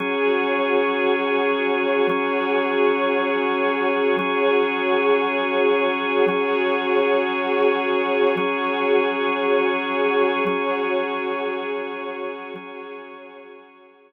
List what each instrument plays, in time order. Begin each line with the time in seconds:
0.00 drawbar organ F#3 C#4 G#4, string ensemble 1 F#4 G#4 C#5
2.09 drawbar organ F#3 C#4 G#4, string ensemble 1 F#4 G#4 C#5
4.19 drawbar organ F#3 C#4 G#4, string ensemble 1 F#4 G#4 C#5
6.28 drawbar organ F#3 C#4 G#4, string ensemble 1 F#4 G#4 C#5
8.36 drawbar organ F#3 C#4 G#4, string ensemble 1 F#4 G#4 C#5
10.47 drawbar organ F#3 C#4 G#4, string ensemble 1 F#4 G#4 C#5
12.56 drawbar organ F#3 C#4 G#4, string ensemble 1 F#4 G#4 C#5